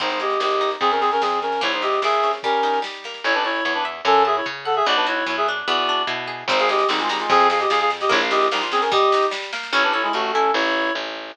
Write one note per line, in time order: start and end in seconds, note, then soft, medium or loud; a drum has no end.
0.00 0.37 G#1 medium
0.00 0.40 C4 medium
0.00 0.10 D#4 medium
0.00 0.10 C5 loud
0.00 kick loud
0.00 snare medium
0.10 0.20 D#4 medium
0.10 0.20 C5 medium
0.10 snare medium
0.20 0.40 G4 medium
0.20 0.77 G#4 medium
0.20 0.40 D#5 medium
0.20 snare medium
0.30 snare medium
0.40 0.77 G#1 medium
0.40 0.79 C4 medium
0.40 0.70 G4 medium
0.40 0.70 D#5 medium
0.40 snare loud
0.51 snare medium
0.61 0.80 D#4 medium
0.61 snare loud
0.71 snare medium
0.80 1.17 F2 medium
0.80 0.90 C4 medium
0.80 0.90 G#4 loud
0.80 kick loud
0.80 snare medium
0.91 1.00 C#4 medium
0.91 1.00 A#4 medium
0.91 snare medium
1.01 1.10 C4 medium
1.01 1.10 G#4 medium
1.01 snare medium
1.11 1.21 C#4 medium
1.11 1.21 A#4 loud
1.11 snare medium
1.21 1.59 F2 medium
1.21 1.39 C4 medium
1.21 1.39 G#4 medium
1.21 snare loud
1.32 snare medium
1.42 1.61 C#4 medium
1.42 1.61 A#4 medium
1.42 snare medium
1.52 snare medium
1.61 1.99 A#1 medium
1.61 2.03 A#3 loud
1.61 1.72 E4 medium
1.61 1.72 C#5 loud
1.61 kick loud
1.61 snare medium
1.72 1.82 D#4 medium
1.72 1.82 C5 medium
1.72 snare medium
1.82 2.40 E4 medium
1.82 2.00 G4 medium
1.82 2.00 D#5 medium
1.82 snare medium
1.92 snare medium
2.02 2.38 A#1 medium
2.02 2.42 A#3 medium
2.02 2.31 G#4 medium
2.02 2.31 E5 loud
2.02 snare loud
2.13 snare medium
2.23 2.43 C#4 medium
2.23 snare medium
2.33 snare medium
2.43 2.82 G3 medium
2.43 2.79 C#4 medium
2.43 2.79 A#4 medium
2.43 kick loud
2.43 snare medium
2.53 snare medium
2.63 3.21 D#4 medium
2.63 snare loud
2.73 snare medium
2.82 3.21 G3 medium
2.82 snare loud
2.94 snare medium
3.04 3.24 A#3 medium
3.04 snare medium
3.14 snare medium
3.24 3.61 A1 medium
3.24 3.34 E4 loud
3.24 3.34 C#5 loud
3.24 3.65 C#5 loud
3.34 3.43 D4 medium
3.34 3.43 B4 loud
3.44 3.64 E4 medium
3.44 3.64 C#5 loud
3.44 4.02 A5 medium
3.64 4.01 E2 medium
3.64 3.74 E4 medium
3.64 3.74 C#5 medium
3.64 4.04 C#5 medium
3.74 3.84 D4 medium
3.74 3.84 B4 medium
3.85 4.04 E5 medium
4.05 4.41 F#2 loud
4.05 4.23 C#4 loud
4.05 4.23 A4 loud
4.05 4.45 C#5 loud
4.25 4.36 G#4 medium
4.25 4.36 E5 medium
4.25 4.83 A5 medium
4.36 4.46 E4 medium
4.36 4.46 C#5 medium
4.46 4.82 C#3 medium
4.46 4.84 C#5 medium
4.65 4.75 A4 medium
4.65 4.75 F#5 loud
4.65 4.85 F#5 medium
4.76 4.85 G#4 medium
4.76 4.85 E5 loud
4.86 5.23 B1 medium
4.86 5.26 B3 loud
4.86 4.96 F#4 loud
4.86 4.96 D5 loud
4.96 5.06 D4 medium
4.96 5.06 B4 medium
5.07 5.25 E4 medium
5.07 5.64 F#4 medium
5.07 5.25 C#5 medium
5.26 5.63 F#2 medium
5.26 5.65 B3 medium
5.26 5.36 E4 medium
5.26 5.36 C#5 medium
5.37 5.47 G#4 medium
5.37 5.47 E5 medium
5.48 5.68 D4 medium
5.67 6.04 E2 medium
5.67 6.45 B3 loud
5.67 6.02 F#4 medium
5.67 6.02 D5 loud
5.89 6.47 D4 medium
6.07 6.44 B2 medium
6.07 6.46 E4 medium
6.27 6.47 G#4 medium
6.48 6.84 G#1 loud
6.48 6.70 C4 loud
6.48 6.59 D#4 medium
6.48 6.59 C5 loud
6.48 kick loud
6.48 snare loud
6.59 6.69 G#4 medium
6.59 6.69 F5 loud
6.59 snare loud
6.69 6.87 G4 medium
6.69 6.89 G#4 medium
6.69 6.87 D#5 medium
6.69 snare loud
6.79 snare loud
6.89 7.26 G#1 medium
6.89 7.00 G3 medium
6.89 7.09 C4 medium
6.89 7.00 D#4 medium
6.89 snare loud
6.99 7.09 G#3 medium
6.99 7.09 F4 loud
6.99 snare loud
7.09 7.19 G3 medium
7.09 7.19 D#4 medium
7.09 7.29 D#4 medium
7.09 snare loud
7.20 7.29 G#3 medium
7.20 7.29 F4 medium
7.20 snare loud
7.29 7.66 F2 loud
7.29 7.47 C4 loud
7.29 7.47 G#4 loud
7.29 kick loud
7.29 snare loud
7.40 snare medium
7.50 7.60 G#4 medium
7.50 7.60 F5 medium
7.50 snare loud
7.60 7.69 G4 medium
7.60 7.69 D#5 medium
7.60 snare loud
7.70 8.07 F2 medium
7.70 7.79 G#4 medium
7.70 7.79 F5 loud
7.70 snare loud
7.80 7.90 G#4 medium
7.80 7.90 F5 loud
7.80 snare medium
7.90 snare loud
8.00 8.10 G4 medium
8.00 8.10 D#5 loud
8.00 snare loud
8.09 8.49 A#1 loud
8.09 8.30 A#3 loud
8.09 8.20 E4 loud
8.09 8.20 C#5 loud
8.09 kick loud
8.09 snare loud
8.21 8.31 F5 medium
8.21 snare medium
8.30 8.52 E4 medium
8.30 8.47 G4 medium
8.30 8.47 D#5 loud
8.30 snare loud
8.41 snare loud
8.51 8.89 A#1 medium
8.51 8.62 G3 medium
8.51 8.72 A#3 medium
8.51 8.62 D#4 medium
8.51 snare loud
8.61 8.71 F4 medium
8.61 snare loud
8.72 8.81 C4 medium
8.72 8.92 C#4 medium
8.72 8.81 G#4 medium
8.72 snare loud
8.81 8.90 C#4 medium
8.81 8.90 A#4 medium
8.81 snare loud
8.92 9.12 G3 loud
8.92 9.26 G4 loud
8.92 9.26 D#5 loud
8.92 kick loud
8.92 snare loud
9.02 snare medium
9.12 9.34 D#4 loud
9.12 snare loud
9.22 snare loud
9.31 9.52 G3 medium
9.31 snare loud
9.42 snare loud
9.53 9.72 A#3 medium
9.53 snare loud
9.63 snare loud
9.72 10.09 A1 medium
9.72 10.13 C#4 loud
9.72 9.83 E4 loud
9.72 9.83 C#5 loud
9.83 9.93 D4 medium
9.83 9.93 B4 loud
9.93 10.02 E4 medium
9.93 10.51 A4 medium
9.93 10.03 C#5 loud
10.03 10.12 G#3 medium
10.03 10.12 E4 loud
10.13 10.51 A1 medium
10.13 10.31 A3 medium
10.13 10.52 C#4 medium
10.13 10.31 F#4 loud
10.33 10.51 C#4 medium
10.33 10.54 E4 medium
10.33 10.51 A4 medium
10.54 10.91 A1 loud
10.54 10.92 E4 loud
10.54 10.92 C#5 loud
10.95 11.32 A1 medium